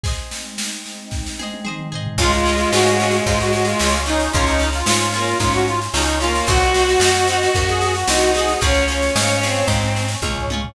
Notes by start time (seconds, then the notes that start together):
0.04 G#3 C4 D#4 G#4 C5 D#5, kick, snare
0.31 snare
0.58 snare
0.86 snare
1.11 kick, snare
1.26 snare
1.39 G#4 C5 D#5, high tom
1.54 high tom
1.65 G#4 C5 D#5, mid tom
1.80 mid tom
1.92 G#4 C5 D#5, floor tom
2.07 floor tom
2.18 C#2 G#3 C#4 F4 C#5 F5 G#5, kick, snare, crash
2.22 G#4
2.32 F4, snare
2.46 C#4 F4 G#4, snare
2.58 F4, snare
2.72 G#2 C#4 F4 F#4 G#4, snare
2.86 snare
3.00 C#4 F4 G#4, snare
3.11 snare
3.26 G#2 F4 C#5 G#5 C#6, kick, snare
3.40 F#4, snare
3.53 F#4, snare
3.65 F4, snare
3.79 C#2 C#4 F4, snare
3.83 G#4
3.93 snare
4.06 C#4 D#4 F4 G#4, snare
4.20 snare
4.33 C#2 C#4 F4 C#5 F5 G#5, kick, snare
4.37 G#4
4.46 D#4, snare
4.59 C#4 F4, snare
4.63 G#4
4.73 F4, snare
4.86 G#2 C#4 F4 G#4, snare
5.00 snare
5.12 A#3 C#4 F4 G#4, snare
5.27 snare
5.40 G#2 C#4 F4 C#5 G#5 C#6, kick, snare
5.53 F#4, snare
5.67 F4, snare
5.82 snare
5.94 C#2 C#4 D#4 F4 G#4, snare
6.05 snare
6.20 A#3 C#4 F4 G#4, snare
6.35 snare
6.46 C2 C4 D#4 F#4 C5 D#5 F#5, kick, snare
6.60 F#4, snare
6.74 C4 D#4, snare
6.79 F#4
6.88 F#4, snare
6.99 F#2 C4 D#4 F#4, snare
7.04 F#4
7.16 snare
7.28 C4 D#4, snare
7.32 F#4
7.43 snare
7.54 F#2 F#4 C5 F#5, kick, snare
7.68 G#4, snare
7.81 G#4, snare
7.95 F#4, snare
8.08 C2 C4 D#4 F#4, snare
8.21 snare
8.35 C4 D#4 F#4 G#4, snare
8.48 snare
8.61 C#2 C#4 F4 G#4 C#5 F5 G#5, kick, snare
8.74 snare
8.88 C#4 F4, snare
8.92 G#4
9.02 snare
9.16 G#2 C#4 F4 G#4, snare
9.30 snare
9.41 C4 C#4 F4 G#4, snare
9.55 snare
9.67 G#2 C#5 G#5 C#6, kick, snare
9.83 snare
9.96 snare
10.08 snare
10.22 C#2 C#4 F4 G#4, kick, high tom
10.38 floor tom
10.50 C#4 F4 G#4, high tom
10.65 floor tom